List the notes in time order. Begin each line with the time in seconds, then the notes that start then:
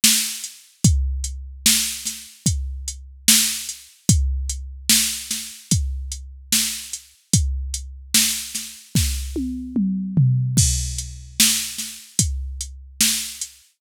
0.04 snare
0.44 closed hi-hat
0.84 kick, closed hi-hat
1.24 closed hi-hat
1.66 snare
2.05 snare, closed hi-hat
2.46 kick, closed hi-hat
2.88 closed hi-hat
3.28 snare
3.69 closed hi-hat
4.09 kick, closed hi-hat
4.49 closed hi-hat
4.90 snare
5.31 snare, closed hi-hat
5.71 kick, closed hi-hat
6.12 closed hi-hat
6.53 snare
6.93 closed hi-hat
7.33 kick, closed hi-hat
7.74 closed hi-hat
8.15 snare
8.55 snare, closed hi-hat
8.95 kick, snare
9.36 high tom
9.76 mid tom
10.17 floor tom
10.57 kick, crash
10.98 closed hi-hat
11.40 snare
11.78 snare, closed hi-hat
12.19 kick, closed hi-hat
12.61 closed hi-hat
13.01 snare
13.42 closed hi-hat